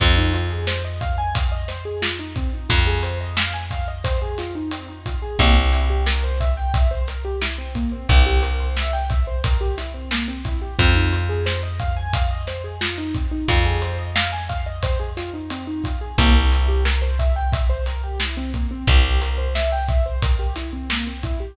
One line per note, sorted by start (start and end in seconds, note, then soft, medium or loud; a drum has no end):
0.00 2.49 F2 medium
0.00 0.15 C4 medium
0.00 kick loud
0.00 closed hi-hat loud
0.17 0.32 D#4 medium
0.34 0.49 F4 medium
0.34 closed hi-hat medium
0.50 0.65 G#4 medium
0.67 0.83 C5 medium
0.67 snare loud
0.85 1.00 D#5 medium
1.01 1.16 F5 medium
1.01 kick medium
1.01 closed hi-hat medium
1.18 1.33 G#5 medium
1.35 1.50 F5 medium
1.35 kick loud
1.35 closed hi-hat loud
1.52 1.67 D#5 medium
1.68 1.83 C5 medium
1.68 snare medium
1.68 closed hi-hat medium
1.85 2.00 G#4 medium
2.02 2.17 F4 medium
2.02 snare loud
2.19 2.34 D#4 medium
2.36 2.51 C4 medium
2.36 kick medium
2.36 closed hi-hat medium
2.53 2.68 D#4 medium
2.69 5.18 F2 medium
2.69 2.85 F4 medium
2.69 kick loud
2.69 closed hi-hat loud
2.87 3.02 G#4 medium
3.03 3.18 C5 medium
3.03 closed hi-hat medium
3.21 3.36 D#5 medium
3.37 3.52 F5 medium
3.37 snare loud
3.54 3.69 G#5 medium
3.71 3.86 F5 medium
3.71 kick medium
3.71 closed hi-hat medium
3.88 4.03 D#5 medium
4.04 4.19 C5 medium
4.04 kick loud
4.04 closed hi-hat loud
4.22 4.37 G#4 medium
4.38 4.54 F4 medium
4.38 snare medium
4.38 closed hi-hat medium
4.55 4.70 D#4 medium
4.71 4.87 C4 medium
4.71 closed hi-hat loud
4.88 5.04 D#4 medium
5.06 5.21 F4 medium
5.06 kick medium
5.06 closed hi-hat medium
5.22 5.37 G#4 medium
5.39 7.87 C2 medium
5.39 5.55 A#3 loud
5.39 kick loud
5.39 closed hi-hat loud
5.56 5.71 C4 medium
5.73 5.88 E4 medium
5.73 closed hi-hat medium
5.90 6.05 G4 medium
6.06 6.22 A#4 medium
6.06 snare loud
6.24 6.39 C5 medium
6.40 6.56 E5 medium
6.40 kick medium
6.40 closed hi-hat medium
6.57 6.72 G5 medium
6.74 6.89 E5 medium
6.74 kick loud
6.74 closed hi-hat loud
6.91 7.06 C5 medium
7.08 7.23 A#4 medium
7.08 snare medium
7.08 closed hi-hat medium
7.25 7.40 G4 medium
7.42 7.57 E4 medium
7.42 snare loud
7.58 7.73 C4 medium
7.75 7.90 A#3 medium
7.75 kick medium
7.75 closed hi-hat medium
7.92 8.07 C4 medium
8.09 10.57 C2 medium
8.09 8.24 E4 medium
8.09 kick loud
8.09 closed hi-hat loud
8.26 8.41 G4 medium
8.43 8.58 A#4 medium
8.43 closed hi-hat medium
8.60 8.75 C5 medium
8.77 8.92 E5 medium
8.77 snare loud
8.93 9.08 G5 medium
9.10 9.25 E5 medium
9.10 kick loud
9.10 snare soft
9.10 closed hi-hat medium
9.27 9.42 C5 medium
9.44 9.59 A#4 medium
9.44 kick loud
9.44 closed hi-hat loud
9.61 9.76 G4 medium
9.78 9.93 E4 medium
9.78 snare medium
9.78 closed hi-hat medium
9.94 10.09 C4 medium
10.11 10.27 A#3 medium
10.11 snare loud
10.28 10.43 C4 medium
10.45 10.60 E4 medium
10.45 kick medium
10.45 closed hi-hat medium
10.62 10.77 G4 medium
10.79 13.27 F2 medium
10.79 10.94 C4 medium
10.79 kick loud
10.79 closed hi-hat loud
10.95 11.10 D#4 medium
11.12 11.28 F4 medium
11.12 closed hi-hat medium
11.29 11.45 G#4 medium
11.46 11.61 C5 medium
11.46 snare loud
11.63 11.78 D#5 medium
11.79 11.95 F5 medium
11.79 kick medium
11.79 closed hi-hat medium
11.97 12.12 G#5 medium
12.13 12.29 F5 medium
12.13 kick loud
12.13 closed hi-hat loud
12.31 12.46 D#5 medium
12.47 12.63 C5 medium
12.47 snare medium
12.47 closed hi-hat medium
12.64 12.79 G#4 medium
12.81 12.96 F4 medium
12.81 snare loud
12.98 13.13 D#4 medium
13.14 13.30 C4 medium
13.14 kick medium
13.14 closed hi-hat medium
13.31 13.46 D#4 medium
13.48 15.96 F2 medium
13.48 13.64 F4 medium
13.48 kick loud
13.48 closed hi-hat loud
13.65 13.80 G#4 medium
13.82 13.97 C5 medium
13.82 closed hi-hat medium
13.99 14.14 D#5 medium
14.16 14.31 F5 medium
14.16 snare loud
14.32 14.48 G#5 medium
14.49 14.64 F5 medium
14.49 kick medium
14.49 closed hi-hat medium
14.66 14.81 D#5 medium
14.83 14.98 C5 medium
14.83 kick loud
14.83 closed hi-hat loud
15.00 15.15 G#4 medium
15.17 15.32 F4 medium
15.17 snare medium
15.17 closed hi-hat medium
15.34 15.49 D#4 medium
15.50 15.66 C4 medium
15.50 closed hi-hat loud
15.67 15.82 D#4 medium
15.84 15.99 F4 medium
15.84 kick medium
15.84 closed hi-hat medium
16.01 16.16 G#4 medium
16.18 18.66 C2 medium
16.18 16.33 A#3 loud
16.18 kick loud
16.18 closed hi-hat loud
16.35 16.50 C4 medium
16.52 16.67 E4 medium
16.52 closed hi-hat medium
16.68 16.84 G4 medium
16.85 17.00 A#4 medium
16.85 snare loud
17.02 17.17 C5 medium
17.19 17.34 E5 medium
17.19 kick medium
17.19 closed hi-hat medium
17.36 17.51 G5 medium
17.53 17.68 E5 medium
17.53 kick loud
17.53 closed hi-hat loud
17.70 17.85 C5 medium
17.86 18.02 A#4 medium
17.86 snare medium
17.86 closed hi-hat medium
18.04 18.19 G4 medium
18.20 18.36 E4 medium
18.20 snare loud
18.37 18.52 C4 medium
18.54 18.69 A#3 medium
18.54 kick medium
18.54 closed hi-hat medium
18.71 18.86 C4 medium
18.87 21.35 C2 medium
18.87 19.03 E4 medium
18.87 kick loud
18.87 closed hi-hat loud
19.04 19.20 G4 medium
19.21 19.37 A#4 medium
19.21 closed hi-hat medium
19.38 19.53 C5 medium
19.55 19.70 E5 medium
19.55 snare loud
19.72 19.87 G5 medium
19.88 20.04 E5 medium
19.88 kick loud
19.88 snare soft
19.88 closed hi-hat medium
20.06 20.21 C5 medium
20.22 20.38 A#4 medium
20.22 kick loud
20.22 closed hi-hat loud
20.39 20.54 G4 medium
20.56 20.71 E4 medium
20.56 snare medium
20.56 closed hi-hat medium
20.73 20.88 C4 medium
20.90 21.05 A#3 medium
20.90 snare loud
21.07 21.22 C4 medium
21.23 21.39 E4 medium
21.23 kick medium
21.23 closed hi-hat medium
21.40 21.55 G4 medium